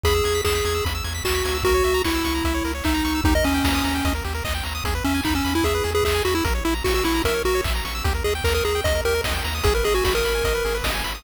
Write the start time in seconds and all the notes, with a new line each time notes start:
0.04 E2 G#4 B5, kick, closed hi-hat
0.15 E6
0.24 E2 G#6, open hi-hat
0.35 B6
0.45 E2 G#4 E7, kick, clap
0.55 B6
0.65 E2 G#6, open hi-hat
0.75 E6
0.85 E2 B5, kick, closed hi-hat
0.95 E6
1.04 E2 G#6, open hi-hat
1.15 B6
1.24 D#2 F#4 E7, kick, clap
1.35 B6
1.45 D2 G#6, open hi-hat
1.55 E6
1.63 C#2 F#4 A#4, kick, closed hi-hat
1.74 C#5
1.84 C#2 E5, open hi-hat
1.94 A#5
2.04 C#2 E4 C#6, kick, clap
2.15 E6
2.24 C#2 C#6, open hi-hat
2.35 A#5
2.44 C#2 E5, kick, closed hi-hat
2.54 C#5
2.65 C#2 A#4, open hi-hat
2.75 C#5
2.84 C#2 D#4 E5, kick, clap
2.95 A#5
3.05 C#2 C#6, open hi-hat
3.15 E6
3.24 D#2 D#4 G4, kick, closed hi-hat
3.35 A#4 D#5
3.44 D#2 C#4 D#5, open hi-hat
3.54 G5
3.64 D#2 A#5, kick, snare
3.75 D#6
3.84 D#2 A#5, open hi-hat
3.95 G5
4.05 D#2 D#5, kick, closed hi-hat
4.15 A#4
4.24 D#2 G4, open hi-hat
4.35 A#4
4.44 D#2 D#5, kick, clap
4.55 G5
4.64 D#2 A#5, open hi-hat
4.75 D#6
4.84 E2 G#4, kick, closed hi-hat
4.95 B4
5.04 E2 C#4 E5, open hi-hat
5.14 G#5
5.24 E2 D#4 B5, kick, clap
5.35 C#4 E6
5.45 E2 B5, open hi-hat
5.55 E4 G#5
5.63 E2 G#4 E5, kick, closed hi-hat
5.75 B4
5.84 E2 G#4, open hi-hat
5.95 G#4 B4
6.03 E2 G#4 E5, kick, clap
6.15 G#5
6.25 E2 F#4 B5, open hi-hat
6.35 E4 E6
6.44 A#1 A#4, kick, closed hi-hat
6.55 C#5
6.65 A#1 E4 E5, open hi-hat
6.75 A#5
6.84 A#1 F#4 C#6, kick, snare
6.94 F#4 E6
7.04 A#1 E4 C#6, open hi-hat
7.14 A#5
7.24 A#1 A#4 E5, kick, closed hi-hat
7.34 C#5
7.45 A#1 F#4 A#4, open hi-hat
7.55 C#5
7.64 A#1 E5, kick, clap
7.75 A#5
7.85 A#1 C#6, open hi-hat
7.95 E6
8.04 D#2 G4, kick, closed hi-hat
8.15 A#4
8.24 D#2 G#4 D#5, open hi-hat
8.35 G5
8.44 D#2 A#4 A#5, kick, clap
8.54 A#4 D#6
8.64 D#2 G#4 A#5, open hi-hat
8.75 G5
8.84 D#2 D#5, kick, closed hi-hat
8.95 A#4
9.05 D#2 G4 A#4, open hi-hat
9.15 A#4
9.24 D#2 D#5, kick, snare
9.34 G5
9.44 D#2 A#5, open hi-hat
9.55 D#6
9.64 G#1 G#4, kick, closed hi-hat
9.75 A#4 B4
9.84 G#1 G#4 D#5, open hi-hat
9.94 F#4 G#5
10.04 G#1 F#4 B5, kick, snare
10.15 A#4 D#6
10.24 G#1 B5, open hi-hat
10.35 G#5
10.44 G#1 D#5, kick, closed hi-hat
10.55 B4
10.65 G#1 G#4, open hi-hat
10.75 B4
10.84 G#1 D#5, kick, snare
10.94 G#5
11.04 G#1 B5, open hi-hat
11.15 D#6